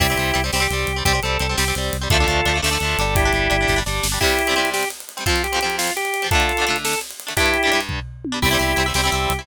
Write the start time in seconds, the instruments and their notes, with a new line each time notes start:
0.00 synth bass 1 C2, overdriven guitar G3 C4, drawbar organ E4 G4, kick, crash
0.10 overdriven guitar G3 C4
0.17 synth bass 1 C2, overdriven guitar G3 C4, ride
0.34 synth bass 1 C2, overdriven guitar G3 C4, ride
0.44 overdriven guitar G3 C4
0.53 synth bass 1 C2, overdriven guitar G3 C4, drawbar organ G4, snare
0.60 overdriven guitar G3 C4
0.70 synth bass 1 C2, overdriven guitar G3 C4, ride
0.87 synth bass 1 C2, ride
0.96 overdriven guitar G3 C4
1.05 synth bass 1 C2, overdriven guitar G3 C4, drawbar organ G4, kick, ride
1.13 overdriven guitar G3 C4
1.23 synth bass 1 C2, overdriven guitar G3 C4, drawbar organ A4, ride
1.40 synth bass 1 C2, overdriven guitar G3 C4, ride
1.49 overdriven guitar G3 C4
1.57 synth bass 1 C2, overdriven guitar G3 C4, drawbar organ G4, snare
1.68 overdriven guitar G3 C4
1.75 synth bass 1 C2, overdriven guitar G3 C4, ride
1.93 synth bass 1 C2, ride
2.01 overdriven guitar G3 C4
2.10 synth bass 1 D2, overdriven guitar F3 A3 D4, drawbar organ F4 A4, kick, ride
2.20 overdriven guitar F3 A3 D4
2.27 synth bass 1 D2, overdriven guitar F3 A3 D4, ride
2.46 synth bass 1 D2, overdriven guitar F3 A3 D4, ride
2.54 overdriven guitar F3 A3 D4
2.62 synth bass 1 D2, overdriven guitar F3 A3 D4, drawbar organ A4, snare
2.71 overdriven guitar F3 A3 D4
2.80 synth bass 1 D2, overdriven guitar A3 D4, ride
2.84 overdriven guitar F3
2.98 synth bass 1 G1, overdriven guitar G3 D4, ride
3.15 drawbar organ E4 G4, kick, ride
3.25 overdriven guitar G3 D4
3.33 synth bass 1 G1, overdriven guitar G3 D4, ride
3.50 synth bass 1 G1, overdriven guitar G3 D4, ride
3.61 overdriven guitar G3 D4
3.67 synth bass 1 G1, overdriven guitar G3 D4, kick, snare, ride
3.76 overdriven guitar G3 D4
3.86 synth bass 1 G1, overdriven guitar G3 D4, snare
4.03 synth bass 1 G1, snare
4.12 overdriven guitar G3 D4
4.21 overdriven guitar C3 G3 C4, drawbar organ E4 G4, kick, crash
4.30 ride
4.39 ride
4.47 overdriven guitar C3 G3 C4, ride
4.56 overdriven guitar C3 G3 C4, ride
4.65 ride
4.74 drawbar organ G4, snare
4.83 ride
4.90 ride
5.00 ride
5.09 ride
5.17 overdriven guitar C3 G3 C4, ride
5.26 overdriven guitar F2 F3 C4, drawbar organ F4, kick, ride
5.36 ride
5.44 drawbar organ G4, ride
5.52 overdriven guitar F2 F3 C4, ride
5.61 overdriven guitar F3 C4, ride
5.66 overdriven guitar F2, ride
5.78 drawbar organ F4, snare
5.88 ride
5.96 drawbar organ G4, ride
6.05 ride
6.14 ride
6.22 overdriven guitar F2 F3 C4, ride
6.31 overdriven guitar D3 A3 D4, drawbar organ F4 A4, kick, ride
6.40 ride
6.49 ride
6.57 overdriven guitar A3 D4, ride
6.61 overdriven guitar D3
6.67 overdriven guitar D3 A3 D4, ride
6.76 ride
6.85 drawbar organ A4, snare
6.93 ride
7.01 ride
7.11 ride
7.20 ride
7.27 overdriven guitar D3 A3 D4, ride
7.37 overdriven guitar G2 G3 D4, drawbar organ E4 G4, kick, ride
7.46 ride
7.54 ride
7.63 overdriven guitar G3 D4, ride
7.67 overdriven guitar G2
7.71 overdriven guitar G2 G3 D4, ride
7.81 ride
7.89 kick, floor tom
8.25 high tom
8.32 overdriven guitar G2 G3 D4
8.42 synth bass 1 C2, overdriven guitar G3 C4 E4, drawbar organ E4 G4, kick, crash
8.51 overdriven guitar G3 C4 E4
8.59 synth bass 1 C2, overdriven guitar G3 C4 E4, ride
8.76 synth bass 1 C2, overdriven guitar G3 C4 E4, ride
8.86 overdriven guitar G3 C4 E4
8.94 synth bass 1 C2, overdriven guitar G3 C4 E4, drawbar organ G4, snare
9.04 overdriven guitar G3 C4 E4
9.12 synth bass 1 C2, overdriven guitar G3 C4 E4, ride
9.30 synth bass 1 C2, ride
9.39 overdriven guitar G3 C4 E4